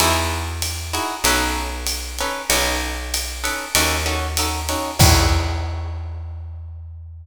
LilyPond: <<
  \new Staff \with { instrumentName = "Acoustic Guitar (steel)" } { \time 4/4 \key e \major \tempo 4 = 96 <dis' e' fis' gis'>4. <dis' e' fis' gis'>8 <cis' dis' a' b'>4. <cis' dis' a' b'>8 | <cis' dis' a' b'>4. <cis' dis' a' b'>8 <cis' dis' fis' a'>8 <cis' dis' fis' a'>8 <cis' dis' fis' a'>8 <cis' dis' fis' a'>8 | <dis' e' fis' gis'>1 | }
  \new Staff \with { instrumentName = "Electric Bass (finger)" } { \clef bass \time 4/4 \key e \major e,2 b,,2 | b,,2 dis,2 | e,1 | }
  \new DrumStaff \with { instrumentName = "Drums" } \drummode { \time 4/4 cymr4 <hhp cymr>8 cymr8 cymr4 <hhp cymr>8 cymr8 | cymr4 <hhp cymr>8 cymr8 cymr4 <hhp cymr>8 cymr8 | <cymc bd>4 r4 r4 r4 | }
>>